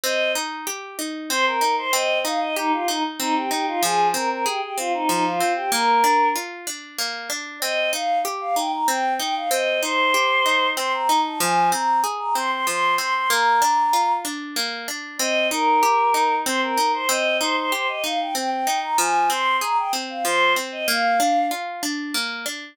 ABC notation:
X:1
M:3/4
L:1/16
Q:1/4=95
K:Cm
V:1 name="Choir Aahs"
e2 z6 c B2 c | e2 f e E F E z E G G F | A2 B B G G F E E F2 G | B4 z8 |
e2 f2 z f g b g2 g f | e2 c6 c' b2 =a | a2 b2 z b c' c' c'2 c' c' | b6 z6 |
e2 B6 c B2 c | e2 c c c e f g g g2 b | a2 c'2 b g z f c2 z e | f4 z8 |]
V:2 name="Orchestral Harp"
C2 E2 G2 E2 C2 E2 | C2 E2 G2 E2 C2 E2 | F,2 C2 A2 C2 F,2 C2 | B,2 D2 F2 D2 B,2 D2 |
C2 E2 G2 E2 C2 E2 | C2 E2 G2 E2 C2 E2 | F,2 C2 A2 C2 F,2 C2 | B,2 D2 F2 D2 B,2 D2 |
C2 E2 G2 E2 C2 E2 | C2 E2 G2 E2 C2 E2 | F,2 C2 A2 C2 F,2 C2 | B,2 D2 F2 D2 B,2 D2 |]